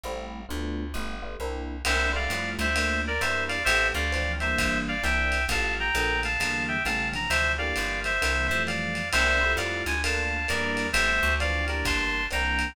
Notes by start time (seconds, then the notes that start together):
0.04 A1 G3 A3 C4 E4
0.49 D2 A3 B3 D4 F4
0.94 G1 G3 A3 B3 F4
1.22 G3 A3 B3 F4
1.40 C2 A#3 C4 D4 E4
1.85 C2 A#3 C4 D4 E4 C5 E5, crash, ride
2.13 G3 A3 E4 F4 D5 F5
2.30 F2, hi-hat pedal, ride
2.59 D2 C5 E5, ride
2.75 A3 A#3 D4 F4, ride
3.07 A#4 D5
3.21 E2 G3 A#3 D4 E4 C5 E5, hi-hat pedal, ride
3.48 D5 F5, ride
3.65 A1 G3 A3 B3 C4 C5 E5, ride
3.94 D2 D5 F5
4.12 E3 F3 C4 D4, hi-hat pedal, ride
4.40 E3 G3 A#3 D4 C5 E5, ride
4.58 G1, kick, ride
4.88 D5 F5
5.03 C2 E3 A#3 C4 D4 E5 G5, hi-hat pedal, ride
5.32 ride
5.48 A1 E3 F3 G3 A3 F5 A5, kick, ride
5.80 G5 A#5
5.95 A#1 D3 F3 A3 A#3, hi-hat pedal, ride
6.23 F5 A5, ride
6.40 E2 D3 E3 G3 A#3, ride
6.68 E5 G5
6.85 A1 C#3 G3 A3 B3 F5 A5, hi-hat pedal, ride
7.12 C3 D3 E3 F3 A#5, ride
7.30 D2 C5 E5, ride
7.58 D3 E3 G3 A#3 D5 F5
7.76 G1, hi-hat pedal, ride
8.04 C5 E5, ride
8.21 C2 C3 D3 E3 A#3, ride
8.47 F2 E3 F3 G3 A3 C5 E5
8.67 D5 F5, hi-hat pedal, ride
8.95 ride
9.12 C2 A#3 C4 D4 E4 C5 E5, crash, ride
9.41 G3 A3 E4 F4
9.57 F2 D5 F5, hi-hat pedal, ride
9.86 D2 G#5, ride
10.04 A3 A#3 D4 F4 F5 A5, ride
10.48 E2 G3 A#3 D4 E4 A#4 D5, hi-hat pedal, ride
10.77 ride
10.93 A1 G3 A3 B3 C4 C5 E5, ride
11.23 D2
11.40 E3 F3 C4 D4 D5 F5, hi-hat pedal, ride
11.68 E3 G3 A#3 D4 A#4 D5, ride
11.85 G1 A5 C6, kick, ride
12.30 C2 E3 A#3 C4 D4 G5 A#5, hi-hat pedal, ride
12.59 ride